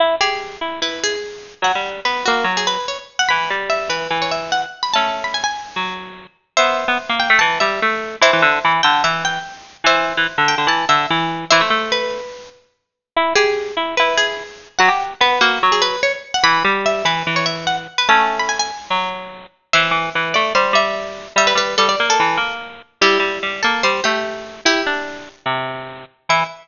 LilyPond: <<
  \new Staff \with { instrumentName = "Harpsichord" } { \time 4/4 \key e \major \tempo 4 = 146 r8 gis'4 r8 b'8 gis'4. | fis''8. r16 b'8 fis'8. gis'16 b'8 cis''16 r8 fis''16 | b''8. r16 e''8 b'8. cis''16 e''8 fis''16 r8 b''16 | a''8. b''16 gis''16 gis''4~ gis''16 r4. |
\key e \minor <c'' e''>4. g''8 a''8 e''4. | <c'' e''>4. g''8 e''8 g''4. | <c'' e''>4. g''8 a''8 e''4. | <c'' e''>4 b'4. r4. |
\key e \major r8 gis'4 r8 b'8 gis'4. | fis''8. r16 b'8 fis'8. gis'16 b'8 cis''16 r8 fis''16 | b''8. r16 e''8 b'8. cis''16 e''8 fis''16 r8 b'16 | a''8. b''16 gis''16 gis''4~ gis''16 r4. |
\key e \minor <c'' e''>4. d''8 c''8 e''4. | e''16 b'16 b'8 a'16 d''8 a'4~ a'16 r4 | <e' g'>4. a'8 c''8 g'4. | <e' g'>2~ <e' g'>8 r4. |
e''4 r2. | }
  \new Staff \with { instrumentName = "Harpsichord" } { \time 4/4 \key e \major e'8 g'4 e'8 e'2 | fis16 g8. b8 ais8 fis4 r4 | e8 g4 e8 e2 | <a cis'>2 fis4. r8 |
\key e \minor b8. b16 r16 bes8 a16 e8 g8 a4 | e16 e16 d8 e8 d8 e4 r4 | e8. e16 r16 d8 d16 e8 d8 e4 | e16 a16 a2 r4. |
\key e \major e'8 g'4 e'8 e'2 | fis16 g'8. b8 ais8 fis4 r4 | e8 g4 e8 e2 | <a cis'>2 fis4. r8 |
\key e \minor e8 e8 e8 a8 g8 g4. | g8 g8 g8 ais8 e8 ais4. | g8 g8 g8 ais8 g8 a4. | e'8 d'4. c4. r8 |
e4 r2. | }
>>